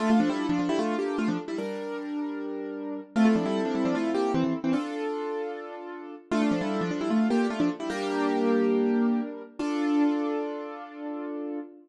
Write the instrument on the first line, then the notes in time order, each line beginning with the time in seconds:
acoustic grand piano
0.00 A3 D4 F4 A4
0.10 A3 F4
0.20 F3 D4
0.29 G3 E4
0.49 F3 D4
0.59 F3 D4
0.69 G3 E4
0.79 A3 F4
0.99 A#3 G4
1.18 A3 F4
1.28 F3 D4
1.48 G3 E4
1.58 G3 D4 A#4
3.16 A3 C4 E4 F4 A4
3.25 A3 F4
3.36 F3 D4
3.46 G3 E4
3.65 F3 D4
3.75 G3 E4
3.85 F3 D4
3.95 A3 F4
4.14 A#3 G4
4.34 E3 C4
4.44 E3 C4
4.64 E3 C4
4.73 D4 F4 A4
6.31 A3 D4 F4 A4
6.42 A3 F4
6.51 F3 D4
6.61 G3 E4
6.81 F3 D4
6.91 F3 D4
7.01 G3 E4
7.10 A3 F4
7.30 A#3 G4
7.50 A3 F4
7.60 F3 D4
7.80 G3 E4
7.90 G3 A#3 D4 G4 A#4
9.59 D4 F4 A4